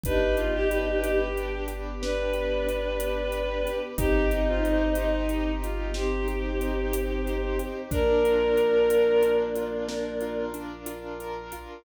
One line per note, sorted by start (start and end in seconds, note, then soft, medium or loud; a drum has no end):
0.04 3.67 G1 loud
0.04 3.94 B3 medium
0.04 3.94 D4 medium
0.04 1.36 D4 loud
0.04 1.20 D#4 loud
0.04 1.20 G4 loud
0.04 3.94 G4 medium
0.04 0.35 B4 medium
0.04 kick medium
0.04 closed hi-hat medium
0.37 0.53 F4 medium
0.37 1.03 G4 medium
0.37 closed hi-hat medium
0.54 0.70 G4 medium
0.70 1.00 G4 medium
0.70 2.02 B4 medium
0.70 closed hi-hat medium
1.03 1.61 G4 medium
1.03 1.67 G4 medium
1.03 closed hi-hat medium
1.36 2.66 D4 medium
1.36 closed hi-hat medium
1.68 2.33 G4 medium
1.68 closed hi-hat medium
2.02 3.71 D4 loud
2.02 3.78 B4 medium
2.02 3.32 B4 medium
2.02 snare medium
2.33 3.00 G4 medium
2.33 closed hi-hat medium
2.67 3.91 D4 medium
2.67 closed hi-hat medium
3.00 3.65 G4 medium
3.00 closed hi-hat medium
3.32 3.95 B4 medium
3.32 closed hi-hat medium
3.65 3.96 G4 medium
3.65 closed hi-hat medium
3.98 7.60 G1 loud
3.98 5.11 C4 medium
3.98 7.88 C4 medium
3.98 5.29 D#4 loud
3.98 5.11 D#4 loud
3.98 7.88 D#4 medium
3.98 4.28 G4 loud
3.98 7.88 G4 medium
3.98 kick medium
3.98 closed hi-hat loud
4.31 4.47 D#4 medium
4.31 4.96 G4 medium
4.31 closed hi-hat medium
4.47 4.63 F4 medium
4.64 4.91 D#4 medium
4.64 5.94 C5 medium
4.64 closed hi-hat medium
4.95 5.51 D#4 medium
4.95 5.62 G4 medium
4.95 closed hi-hat medium
5.29 6.61 D#4 medium
5.29 closed hi-hat medium
5.62 5.90 F4 medium
5.62 6.28 G4 medium
5.62 closed hi-hat medium
5.94 7.81 C4 medium
5.94 7.61 G4 medium
5.94 7.25 C5 medium
5.94 snare medium
6.28 6.93 G4 medium
6.28 closed hi-hat medium
6.61 7.86 D#4 medium
6.61 closed hi-hat medium
6.93 7.59 G4 medium
6.93 closed hi-hat loud
7.26 7.88 C5 medium
7.26 closed hi-hat medium
7.59 7.90 G4 medium
7.59 closed hi-hat medium
7.91 11.53 A#1 loud
7.91 10.45 A#3 medium
7.91 9.22 D4 loud
7.91 10.45 D4 loud
7.91 9.31 A#4 medium
7.91 kick medium
7.91 closed hi-hat medium
8.24 8.89 F4 medium
8.24 closed hi-hat medium
8.57 9.88 A#4 medium
8.57 closed hi-hat medium
8.90 9.55 F4 medium
8.90 closed hi-hat medium
9.23 10.54 D4 medium
9.23 closed hi-hat medium
9.56 10.21 F4 medium
9.56 closed hi-hat medium
9.88 11.20 A#4 medium
9.88 snare medium
10.21 10.86 F4 medium
10.21 closed hi-hat medium
10.54 11.79 D4 medium
10.54 closed hi-hat medium
10.86 11.52 F4 medium
10.86 closed hi-hat medium
11.20 11.82 A#4 medium
11.20 closed hi-hat medium
11.52 11.84 F4 medium
11.52 closed hi-hat medium